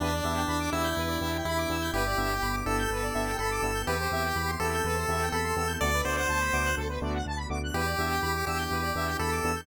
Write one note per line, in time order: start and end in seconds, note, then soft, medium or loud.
0.00 0.21 E2 loud
0.00 1.90 B3 medium
0.00 0.09 B3 medium
0.00 0.70 D4 medium
0.00 1.90 D4 medium
0.00 0.09 D4 medium
0.00 1.90 E4 medium
0.00 0.09 E4 medium
0.00 1.90 G4 medium
0.00 0.09 G4 medium
0.00 0.12 B4 loud
0.13 0.23 D5 medium
0.23 0.45 E2 medium
0.23 0.41 B3 medium
0.23 0.41 D4 medium
0.23 0.41 E4 medium
0.23 0.41 G4 medium
0.23 0.34 E5 medium
0.36 0.46 G5 medium
0.47 0.69 E2 medium
0.47 0.58 B5 medium
0.60 0.71 D6 medium
0.71 0.93 E2 medium
0.71 0.89 B3 medium
0.71 0.89 D4 medium
0.71 0.89 E4 medium
0.71 1.38 E4 medium
0.71 0.89 G4 medium
0.71 0.82 E6 medium
0.84 0.94 G6 medium
0.97 1.17 E2 medium
0.97 1.09 B4 medium
1.08 1.19 D5 medium
1.20 1.41 E2 medium
1.20 1.38 B3 medium
1.20 1.38 D4 medium
1.20 1.38 E4 medium
1.20 1.38 G4 medium
1.20 1.31 E5 medium
1.34 1.45 G5 medium
1.45 1.66 E2 medium
1.45 1.91 E4 medium
1.45 1.58 B5 loud
1.57 1.68 D6 medium
1.69 1.90 E2 medium
1.69 1.77 B3 medium
1.69 1.77 D4 medium
1.69 1.77 E4 medium
1.69 1.77 G4 medium
1.69 1.82 E6 medium
1.81 1.92 G6 medium
1.93 2.14 G1 medium
1.93 3.85 B3 medium
1.93 2.03 B3 medium
1.93 3.85 D4 medium
1.93 2.03 D4 medium
1.93 3.85 E4 medium
1.93 2.03 E4 medium
1.93 3.85 G4 medium
1.93 2.56 G4 medium
1.93 2.03 G4 medium
1.93 2.05 B4 medium
2.06 2.17 D5 medium
2.17 2.39 G1 medium
2.17 2.34 B3 medium
2.17 2.34 D4 medium
2.17 2.34 E4 medium
2.17 2.34 G4 medium
2.17 2.28 E5 medium
2.32 2.43 G5 medium
2.42 2.63 G1 medium
2.42 2.52 B5 medium
2.53 2.64 D6 medium
2.66 2.87 G1 medium
2.66 2.83 B3 medium
2.66 2.83 D4 medium
2.66 2.83 E4 medium
2.66 2.83 G4 medium
2.66 3.37 A4 medium
2.66 2.77 E6 medium
2.79 2.90 G6 medium
2.90 3.11 G1 medium
2.90 3.03 B4 medium
3.02 3.13 D5 medium
3.14 3.35 G1 medium
3.14 3.31 B3 medium
3.14 3.31 D4 medium
3.14 3.31 E4 medium
3.14 3.31 G4 medium
3.14 3.25 E5 medium
3.28 3.39 G5 medium
3.39 3.60 G1 medium
3.39 3.82 A4 medium
3.39 3.50 B5 medium
3.51 3.62 D6 medium
3.62 3.83 G1 medium
3.62 3.71 B3 medium
3.62 3.71 D4 medium
3.62 3.71 E4 medium
3.62 3.71 G4 medium
3.62 3.73 E6 medium
3.74 3.85 G6 medium
3.87 4.08 E2 medium
3.87 3.96 B3 medium
3.87 5.79 B3 medium
3.87 3.96 C4 medium
3.87 5.79 C4 medium
3.87 3.96 E4 medium
3.87 5.79 E4 medium
3.87 3.96 G4 medium
3.87 4.51 G4 medium
3.87 5.79 G4 medium
3.87 3.98 B4 loud
4.00 4.11 C5 medium
4.11 4.32 E2 medium
4.11 4.29 B3 medium
4.11 4.29 C4 medium
4.11 4.29 E4 medium
4.11 4.29 G4 medium
4.11 4.23 E5 medium
4.24 4.35 G5 medium
4.35 4.56 E2 medium
4.35 4.46 B5 medium
4.47 4.58 C6 medium
4.59 4.80 E2 medium
4.59 4.76 B3 medium
4.59 4.76 C4 medium
4.59 4.76 E4 medium
4.59 4.76 G4 medium
4.59 5.29 A4 medium
4.59 4.72 E6 medium
4.74 4.85 G6 medium
4.84 5.05 E2 medium
4.84 4.96 B4 medium
4.94 5.05 C5 medium
5.08 5.29 E2 medium
5.08 5.25 B3 medium
5.08 5.25 C4 medium
5.08 5.25 E4 medium
5.08 5.25 G4 medium
5.08 5.20 E5 medium
5.22 5.33 G5 medium
5.32 5.53 E2 medium
5.32 5.73 A4 medium
5.32 5.44 B5 medium
5.43 5.54 C6 medium
5.56 5.77 E2 medium
5.56 5.65 B3 medium
5.56 5.65 C4 medium
5.56 5.65 E4 medium
5.56 5.65 G4 medium
5.56 5.68 E6 medium
5.67 5.78 G6 medium
5.80 6.02 D2 loud
5.80 7.73 A3 medium
5.80 5.90 A3 medium
5.80 7.72 B3 medium
5.80 5.90 B3 medium
5.80 7.72 D4 medium
5.80 5.90 D4 medium
5.80 7.73 F#4 medium
5.80 5.90 F#4 medium
5.80 5.90 A4 loud
5.80 6.02 D5 loud
5.94 6.05 B4 medium
6.04 6.25 D2 medium
6.04 6.21 A3 medium
6.04 6.21 B3 medium
6.04 6.21 D4 medium
6.04 6.21 F#4 medium
6.04 6.16 C5 medium
6.04 6.16 D5 medium
6.17 6.76 C5 medium
6.17 6.27 F#5 medium
6.29 6.49 D2 medium
6.29 6.39 A5 medium
6.41 6.51 B5 medium
6.53 6.74 D2 medium
6.53 6.70 A3 medium
6.53 6.70 B3 medium
6.53 6.70 D4 medium
6.53 6.70 F#4 medium
6.53 6.64 D6 medium
6.66 6.76 F#6 medium
6.77 6.98 D2 medium
6.77 6.87 A4 loud
6.89 7.00 B4 medium
7.01 7.22 D2 medium
7.01 7.18 A3 medium
7.01 7.18 B3 medium
7.01 7.18 D4 medium
7.01 7.18 F#4 medium
7.01 7.13 D5 medium
7.14 7.25 F#5 medium
7.26 7.46 D2 medium
7.26 7.38 A5 medium
7.37 7.48 B5 medium
7.49 7.71 D2 medium
7.49 7.58 A3 medium
7.49 7.58 B3 medium
7.49 7.58 D4 medium
7.49 7.58 F#4 medium
7.49 7.60 D6 medium
7.63 7.74 F#6 medium
7.73 7.95 E2 medium
7.73 9.65 B3 medium
7.73 7.82 B3 medium
7.73 9.65 D4 medium
7.73 7.82 D4 medium
7.73 9.65 E4 medium
7.73 7.82 E4 medium
7.73 9.65 G4 medium
7.73 7.82 G4 medium
7.73 8.45 G4 medium
7.73 7.85 B4 loud
7.85 7.96 D5 medium
7.98 8.19 E2 medium
7.98 8.15 B3 medium
7.98 8.15 D4 medium
7.98 8.15 E4 medium
7.98 8.15 G4 medium
7.98 8.09 E5 medium
8.10 8.21 G5 medium
8.22 8.43 E2 medium
8.22 8.33 B5 medium
8.35 8.45 D6 medium
8.46 8.67 E2 medium
8.46 8.63 B3 medium
8.46 8.63 D4 medium
8.46 8.63 E4 medium
8.46 8.63 G4 medium
8.46 9.17 G4 medium
8.46 8.58 E6 medium
8.58 8.69 G6 medium
8.71 8.91 E2 medium
8.71 8.82 B4 medium
8.82 8.93 D5 medium
8.95 9.15 E2 medium
8.95 9.12 B3 medium
8.95 9.12 D4 medium
8.95 9.12 E4 medium
8.95 9.12 G4 medium
8.95 9.07 E5 medium
9.06 9.17 G5 medium
9.19 9.40 E2 medium
9.19 9.61 A4 medium
9.19 9.30 B5 medium
9.32 9.42 D6 medium
9.44 9.64 E2 medium
9.44 9.52 B3 medium
9.44 9.52 D4 medium
9.44 9.52 E4 medium
9.44 9.52 G4 medium
9.44 9.55 E6 medium
9.56 9.66 G6 medium